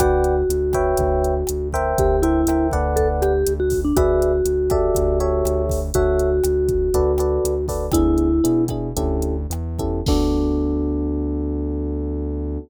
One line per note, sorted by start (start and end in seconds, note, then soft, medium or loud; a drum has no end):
0.00 0.43 D2 loud
0.00 1.68 F#4 loud
0.00 0.35 B4 loud
0.00 0.35 D5 loud
0.00 0.35 F#5 medium
0.00 0.35 G5 medium
0.00 kick medium
0.00 cross-stick loud
0.00 closed hi-hat loud
0.24 closed hi-hat medium
0.49 0.94 D2 medium
0.49 closed hi-hat loud
0.73 1.34 B4 loud
0.73 1.34 C#5 loud
0.73 1.34 E5 medium
0.73 1.34 G5 loud
0.73 kick medium
0.73 cross-stick medium
0.73 closed hi-hat medium
0.97 1.43 D2 loud
0.97 kick medium
0.97 closed hi-hat loud
1.24 closed hi-hat medium
1.47 1.94 D2 medium
1.47 cross-stick medium
1.47 closed hi-hat loud
1.73 2.16 A#4 loud
1.73 2.16 C5 loud
1.73 2.16 E5 loud
1.73 2.16 G5 loud
1.73 kick medium
1.73 closed hi-hat medium
1.98 2.44 D2 loud
1.98 2.23 G4 loud
1.98 kick loud
1.98 closed hi-hat loud
2.22 2.68 E4 loud
2.22 2.41 A#4 medium
2.22 2.41 C5 medium
2.22 2.41 E5 medium
2.22 2.41 G5 medium
2.22 closed hi-hat medium
2.47 2.71 D2 medium
2.47 2.72 A#4 medium
2.47 2.72 C5 medium
2.47 2.72 E5 medium
2.47 2.72 G5 medium
2.47 cross-stick loud
2.47 closed hi-hat loud
2.71 3.43 D2 loud
2.71 3.32 A4 medium
2.71 3.32 B4 medium
2.71 3.32 D5 loud
2.71 3.32 F#5 loud
2.71 kick medium
2.71 closed hi-hat medium
2.96 3.08 A4 loud
2.96 kick medium
2.96 closed hi-hat medium
3.22 3.53 G4 loud
3.22 cross-stick medium
3.22 closed hi-hat medium
3.47 3.92 D2 loud
3.47 closed hi-hat loud
3.60 3.80 F#4 medium
3.70 kick medium
3.70 open hi-hat medium
3.85 3.96 D4 medium
3.96 4.41 D2 loud
3.96 5.64 F#4 loud
3.96 4.32 G#4 loud
3.96 4.32 B4 loud
3.96 4.32 D5 medium
3.96 4.32 E5 loud
3.96 kick loud
3.96 cross-stick loud
3.96 closed hi-hat loud
4.22 closed hi-hat medium
4.45 4.90 D2 medium
4.45 closed hi-hat loud
4.70 5.18 G4 loud
4.70 5.18 A4 loud
4.70 5.18 D5 loud
4.70 5.18 E5 medium
4.70 kick medium
4.70 cross-stick medium
4.70 closed hi-hat medium
4.95 5.43 D2 loud
4.95 kick medium
4.95 closed hi-hat loud
5.20 5.80 G4 medium
5.20 5.80 A4 medium
5.20 5.80 C#5 loud
5.20 5.80 E5 medium
5.20 closed hi-hat medium
5.45 5.91 D2 loud
5.45 cross-stick medium
5.45 closed hi-hat medium
5.69 kick medium
5.69 open hi-hat medium
5.94 6.40 D2 loud
5.94 7.66 F#4 loud
5.94 6.30 F#4 loud
5.94 6.30 A4 medium
5.94 6.30 C#5 medium
5.94 6.30 E5 loud
5.94 kick medium
5.94 closed hi-hat loud
6.19 closed hi-hat medium
6.44 6.89 D2 loud
6.44 cross-stick medium
6.44 closed hi-hat loud
6.69 kick medium
6.69 closed hi-hat medium
6.94 7.39 D2 loud
6.94 7.12 F#4 loud
6.94 7.12 A4 loud
6.94 7.12 B4 loud
6.94 7.12 D5 loud
6.94 kick medium
6.94 closed hi-hat medium
7.18 7.54 F#4 medium
7.18 7.54 A4 medium
7.18 7.54 B4 medium
7.18 7.54 D5 medium
7.18 cross-stick medium
7.18 closed hi-hat medium
7.44 7.89 D2 medium
7.44 closed hi-hat loud
7.68 7.86 F#4 medium
7.68 7.86 A4 medium
7.68 7.86 B4 medium
7.68 7.86 D5 medium
7.68 kick medium
7.68 open hi-hat medium
7.92 8.40 D2 loud
7.92 8.28 B3 medium
7.92 8.28 D4 loud
7.92 8.65 E4 loud
7.92 8.28 E4 medium
7.92 8.28 G#4 loud
7.92 kick medium
7.92 cross-stick loud
7.92 closed hi-hat loud
8.18 closed hi-hat medium
8.44 8.92 B2 medium
8.44 8.62 B3 medium
8.44 8.62 D4 medium
8.44 8.62 E4 medium
8.44 8.62 G#4 medium
8.44 closed hi-hat loud
8.68 8.89 B3 medium
8.68 8.89 D4 medium
8.68 8.89 E4 medium
8.68 8.89 G#4 medium
8.68 kick medium
8.68 cross-stick medium
8.68 closed hi-hat medium
8.97 9.46 D2 loud
8.97 9.35 C#4 loud
8.97 9.35 E4 medium
8.97 9.35 G4 medium
8.97 9.35 A4 medium
8.97 kick medium
8.97 closed hi-hat loud
9.22 closed hi-hat medium
9.50 10.01 E2 loud
9.50 cross-stick medium
9.50 closed hi-hat medium
9.79 9.99 C#4 medium
9.79 9.99 E4 medium
9.79 9.99 G4 medium
9.79 9.99 A4 medium
9.79 kick medium
9.79 closed hi-hat medium
10.06 12.58 D2 loud
10.06 12.59 B3 medium
10.06 12.59 D4 loud
10.06 12.60 D4 loud
10.06 12.59 F#4 medium
10.06 12.59 A4 loud
10.06 kick loud
10.06 crash loud